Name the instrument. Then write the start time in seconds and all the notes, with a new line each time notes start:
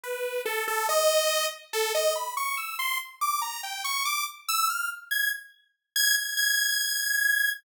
lead 2 (sawtooth)
0.04 B4
0.45 A4
0.68 A4
0.89 D#5
1.73 A4
1.95 D#5
2.15 B5
2.37 C#6
2.57 E6
2.79 C6
3.21 D6
3.42 A#5
3.63 G5
3.84 C#6
4.05 D6
4.49 E6
4.70 F6
5.11 G#6
5.96 G#6
6.17 G#6
6.37 G#6